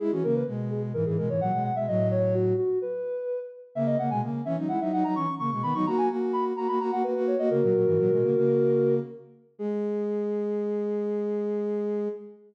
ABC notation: X:1
M:4/4
L:1/16
Q:1/4=128
K:G#m
V:1 name="Ocarina"
G F A B z2 G z A G A c f2 f e | d2 c2 F2 F2 B6 z2 | e d f g z2 e z f e f a c'2 c' c' | b c' a g z2 b z a b a f B2 c d |
"^rit." [FA]12 z4 | G16 |]
V:2 name="Ocarina"
[G,E] [E,C] [C,A,]2 [B,,G,]4 [G,,E,] [G,,E,] [B,,G,] [G,,E,] [A,,F,] [B,,G,]2 [B,,G,] | [=A,,F,]6 z10 | [C,A,]2 [C,A,] [B,,G,] [C,A,]2 [E,C] [F,D] [G,E] [F,D] [F,D] [F,D] [E,C] z [C,A,] [B,,G,] | [D,B,] [F,D] [A,F]2 [A,F]4 [A,F] [A,F] [A,F] [A,F] [A,F] [A,F]2 [A,F] |
"^rit." [C,A,] [A,,F,] [A,,F,] [G,,E,] [A,,F,] [B,,G,] [C,A,] [C,A,]5 z4 | G,16 |]